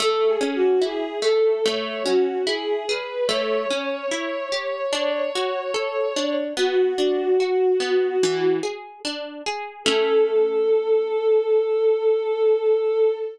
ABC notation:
X:1
M:4/4
L:1/8
Q:1/4=73
K:A
V:1 name="Violin"
(3A G F G A c F G B | c8 | F5 z3 | A8 |]
V:2 name="Orchestral Harp"
A, C E A, A, C E G | A, C E =G D F A D | B, D F B, E, G D G | [A,CE]8 |]